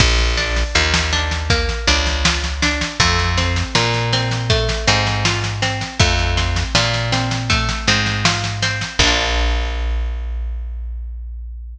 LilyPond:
<<
  \new Staff \with { instrumentName = "Orchestral Harp" } { \time 4/4 \key bes \major \tempo 4 = 80 bes8 d'8 f'8 d'8 bes8 d'8 f'8 d'8 | a8 c'8 f'8 c'8 a8 c'8 f'8 c'8 | a8 c'8 f'8 c'8 a8 c'8 f'8 c'8 | <bes d' f'>1 | }
  \new Staff \with { instrumentName = "Electric Bass (finger)" } { \clef bass \time 4/4 \key bes \major bes,,4 ees,4. des,4. | f,4 bes,4. aes,4. | f,4 bes,4. aes,4. | bes,,1 | }
  \new DrumStaff \with { instrumentName = "Drums" } \drummode { \time 4/4 <cymc bd sn>16 sn16 sn16 sn16 sn16 sn16 sn16 sn16 <bd sn>16 sn16 sn16 sn16 sn16 sn16 sn16 sn16 | <bd sn>16 sn16 sn16 sn16 sn16 sn16 sn16 sn16 <bd sn>16 sn16 sn16 sn16 sn16 sn16 sn16 sn16 | <bd sn>16 sn16 sn16 sn16 sn16 sn16 sn16 sn16 <bd sn>16 sn16 sn16 sn16 sn16 sn16 sn16 sn16 | <cymc bd>4 r4 r4 r4 | }
>>